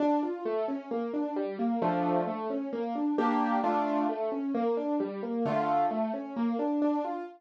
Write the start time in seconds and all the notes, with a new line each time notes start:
0.00 D4
0.23 F4
0.45 A3
0.68 C#4
0.91 A#3
1.14 D4
1.36 G3
1.59 A#3
1.82 F3 A3 D4
2.27 A3
2.50 C#4
2.73 A#3
2.95 D4
3.18 A#3 D4 G4
3.64 A3 D4 F4
4.09 A3
4.32 C#4
4.55 A#3
4.77 D4
5.00 G3
5.23 A#3
5.45 D3 A3 F4
5.91 A3
6.14 C#4
6.36 A#3
6.59 D4
6.82 D4
7.05 F4